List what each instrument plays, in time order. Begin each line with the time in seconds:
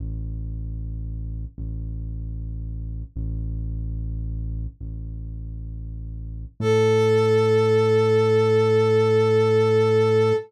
0.00 synth bass 1 A1
1.58 synth bass 1 A1
3.16 synth bass 1 A1
4.81 synth bass 1 A1
6.60 synth bass 1 A2, brass section A4